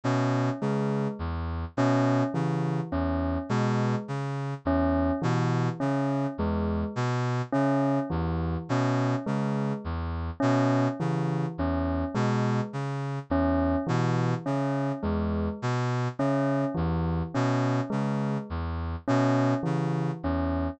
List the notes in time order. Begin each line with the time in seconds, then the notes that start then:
0.04 B2 C#4
0.62 C#3 G#3
1.19 E2
1.77 B2 C#4
2.34 C#3 E3
2.92 E2 C#4
3.49 B2 G#3
4.08 C#3
4.65 E2 C#4
5.22 B2 E3
5.80 C#3 C#4
6.38 E2 G#3
6.96 B2
7.53 C#3 C#4
8.10 E2 E3
8.69 B2 C#4
9.26 C#3 G#3
9.85 E2
10.40 B2 C#4
11.00 C#3 E3
11.58 E2 C#4
12.15 B2 G#3
12.73 C#3
13.30 E2 C#4
13.87 B2 E3
14.46 C#3 C#4
15.03 E2 G#3
15.62 B2
16.19 C#3 C#4
16.75 E2 E3
17.35 B2 C#4
17.90 C#3 G#3
18.50 E2
19.08 B2 C#4
19.63 C#3 E3
20.23 E2 C#4